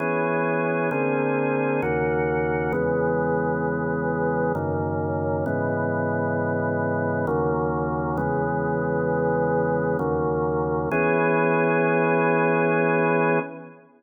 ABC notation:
X:1
M:3/4
L:1/8
Q:1/4=66
K:Elyd
V:1 name="Drawbar Organ"
[E,B,CG]2 [=D,A,^B,G]2 [^D,,C,A,F]2 | [E,,C,G,B,]4 [F,,C,D,A,]2 | [G,,C,E,B,]4 [D,,C,F,A,]2 | [E,,C,G,B,]4 [D,,C,F,A,]2 |
[E,B,CG]6 |]